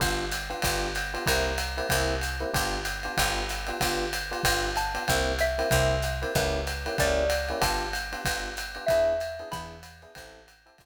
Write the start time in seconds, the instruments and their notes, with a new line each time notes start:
0.00 electric bass (finger) G1, electric piano 1 B3 D4 F4 G4, kick, ride
0.31 hi-hat pedal, ride
0.49 electric piano 1 B3 D4 F4 G4, ride
0.62 electric bass (finger) G1, electric piano 1 B3 D4 F4 G4, kick, ride
0.95 hi-hat pedal, ride
1.14 electric piano 1 B3 D4 F4 G4, ride
1.26 electric bass (finger) C2, electric piano 1 A#3 C4 E4 G4, xylophone A#5, kick, ride
1.58 hi-hat pedal, ride
1.77 electric piano 1 A#3 C4 E4 G4, ride
1.89 electric bass (finger) C2, electric piano 1 A#3 C4 E4 G4, kick, ride
2.21 hi-hat pedal, ride
2.40 electric piano 1 A#3 C4 E4 G4, ride
2.54 electric bass (finger) G1, electric piano 1 B3 D4 F4 G4, kick, ride
2.85 hi-hat pedal, ride
3.03 electric piano 1 B3 D4 F4 G4, ride
3.17 electric bass (finger) G1, electric piano 1 B3 D4 F4 G4, xylophone G5, kick, ride
3.49 hi-hat pedal, ride
3.67 electric piano 1 B3 D4 F4 G4, ride
3.81 electric bass (finger) G1, electric piano 1 B3 D4 F4 G4, kick, ride
4.13 hi-hat pedal, ride
4.31 electric piano 1 B3 D4 F4 G4, ride
4.43 electric bass (finger) G1, electric piano 1 B3 D4 F4 G4, kick, ride
4.76 xylophone A5, hi-hat pedal, ride
4.94 electric piano 1 B3 D4 F4 G4, ride
5.08 electric bass (finger) C2, electric piano 1 A#3 C4 E4 G4, kick, ride
5.39 xylophone E5, hi-hat pedal, ride
5.58 electric piano 1 A#3 C4 E4 G4, ride
5.71 electric bass (finger) C2, electric piano 1 A#3 C4 E4 G4, kick, ride
6.02 hi-hat pedal, ride
6.22 electric piano 1 A#3 C4 E4 G4, ride
6.35 electric bass (finger) C#2, electric piano 1 A#3 C#4 E4 G4, xylophone B4, kick, ride
6.67 hi-hat pedal, ride
6.86 electric piano 1 A#3 C#4 E4 G4, ride
6.98 electric bass (finger) C#2, electric piano 1 A#3 C#4 E4 G4, xylophone D5, kick, ride
7.30 hi-hat pedal, ride
7.49 electric piano 1 A#3 C#4 E4 G4, ride
7.61 electric bass (finger) G1, electric piano 1 B3 D4 F4 G4, xylophone A5, kick, ride
7.93 hi-hat pedal, ride
8.12 electric piano 1 B3 D4 F4 G4, ride
8.25 electric bass (finger) G1, electric piano 1 B3 D4 F4 G4, kick, ride
8.57 hi-hat pedal, ride
8.75 electric piano 1 B3 D4 F4 G4, ride
8.86 electric bass (finger) E2, electric piano 1 B3 D4 E4 G#4, xylophone E5, kick, ride
9.20 hi-hat pedal, ride
9.39 electric piano 1 B3 D4 E4 G#4, ride
9.51 electric bass (finger) E2, electric piano 1 B3 D4 E4 G#4, xylophone B5, kick, ride
9.83 hi-hat pedal, ride
10.02 electric piano 1 B3 D4 E4 G#4, ride
10.15 electric bass (finger) A1, electric piano 1 C4 E4 G4 A4, kick, ride
10.48 hi-hat pedal, ride
10.66 electric piano 1 C4 E4 G4 A4, ride
10.78 electric bass (finger) G1, electric piano 1 B3 D4 F4 G4, kick, ride